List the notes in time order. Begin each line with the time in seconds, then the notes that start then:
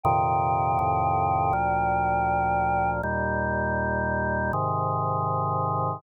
0.04 F2 A#2 C3 D#3 G5
0.79 F2 A2 C3 D#3
1.53 D2 A#2 F3
3.03 D#2 A#2 G3
4.53 G#2 C3 D#3